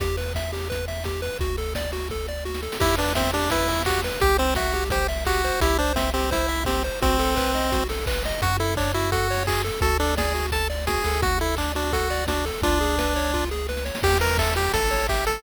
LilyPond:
<<
  \new Staff \with { instrumentName = "Lead 1 (square)" } { \time 4/4 \key e \minor \tempo 4 = 171 r1 | r1 | e'8 d'8 c'8 d'8 e'4 fis'8 r8 | g'8 c'8 fis'4 g'8 r8 fis'4 |
e'8 d'8 c'8 c'8 e'4 c'8 r8 | c'2~ c'8 r4. | \key fis \minor fis'8 e'8 d'8 e'8 fis'4 gis'8 r8 | a'8 d'8 gis'4 a''8 r8 gis'4 |
fis'8 e'8 d'8 d'8 fis'4 d'8 r8 | d'2~ d'8 r4. | \key e \minor g'8 bes'8 a'8 g'8 a'4 g'8 a'8 | }
  \new Staff \with { instrumentName = "Lead 1 (square)" } { \time 4/4 \key e \minor g'8 b'8 e''8 g'8 b'8 e''8 g'8 b'8 | fis'8 a'8 d''8 fis'8 a'8 d''8 fis'8 a'8 | g'8 b'8 e''8 g'8 b'8 e''8 g'8 b'8 | g'8 c''8 e''8 g'8 c''8 e''8 g'8 c''8 |
g'8 c''8 e''8 g'8 c''8 e''8 g'8 c''8 | fis'8 a'8 b'8 dis''8 fis'8 a'8 b'8 dis''8 | \key fis \minor fis'8 a'8 cis''8 fis'8 a'8 cis''8 fis'8 a'8 | fis'8 a'8 d''8 fis'8 a'8 d''8 fis'8 a'8 |
fis'8 a'8 d''8 fis'8 a'8 d''8 fis'8 a'8 | eis'8 gis'8 b'8 cis''8 eis'8 gis'8 b'8 cis''8 | \key e \minor g'8 b'8 e''8 g'8 a'8 cis''8 e''8 a'8 | }
  \new Staff \with { instrumentName = "Synth Bass 1" } { \clef bass \time 4/4 \key e \minor e,1 | d,1 | e,1 | c,1 |
c,1 | b,,1 | \key fis \minor fis,1 | d,2.~ d,8 d,8~ |
d,1 | cis,1 | \key e \minor e,2 a,,2 | }
  \new DrumStaff \with { instrumentName = "Drums" } \drummode { \time 4/4 <hh bd>8 hho8 <bd sn>8 hho8 <hh bd>8 hho8 <bd sn>8 hho8 | <hh bd>8 hho8 <bd sn>8 hho8 <bd sn>8 sn8 sn16 sn16 sn16 sn16 | <cymc bd>8 hho8 <bd sn>8 hho8 <hh bd>8 hho8 <hc bd>8 hho8 | <hh bd>8 hho8 <bd sn>8 hho8 <hh bd>8 hho8 <hc bd>8 hho8 |
<hh bd>8 hho8 <bd sn>8 hho8 <hh bd>8 hho8 <bd sn>8 hho8 | <hh bd>8 hho8 <hc bd>8 hho8 <hh bd>8 hho8 <hc bd>8 hho8 | <hh bd>8 hho8 <hc bd>8 hho8 <hh bd>8 hho8 <hc bd>8 hho8 | <hh bd>8 hho8 <bd sn>8 hho8 <hh bd>8 hho8 <bd sn>8 hho8 |
<hh bd>8 hho8 <hc bd>8 hho8 <hh bd>8 hho8 <bd sn>8 hho8 | <hh bd>8 hho8 <bd sn>8 hho8 <bd sn>8 sn8 sn16 sn16 sn16 sn16 | <cymc bd>8 hho8 <hc bd>8 hho8 <hh bd>8 hho8 <hc bd>8 hho8 | }
>>